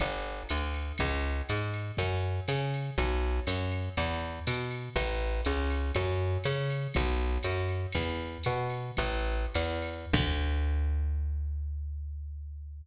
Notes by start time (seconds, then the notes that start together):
0.00 G1, kick, ride
0.49 D2, hi-hat pedal, ride
0.74 ride
0.98 C#2, kick, ride
1.49 G#2, hi-hat pedal, ride
1.74 ride
1.97 F#2, kick, ride
2.48 C#3, hi-hat pedal, ride
2.74 ride
2.98 B1, kick, ride
3.47 F#2, hi-hat pedal, ride
3.72 ride
3.97 E2, kick, ride
4.47 B2, hi-hat pedal, ride
4.71 ride
4.96 A1, kick, ride
5.45 C#2, hi-hat pedal, ride
5.70 ride
5.95 F#2, kick, ride
6.44 C#3, hi-hat pedal, ride
6.70 ride
6.94 B1, kick, ride
7.43 F#2, hi-hat pedal, ride
7.68 ride
7.92 E2, kick, ride
8.43 B2, hi-hat pedal, ride
8.70 ride
8.97 A1, kick, ride
9.54 E2, hi-hat pedal, ride
9.82 ride
10.13 D2, kick, crash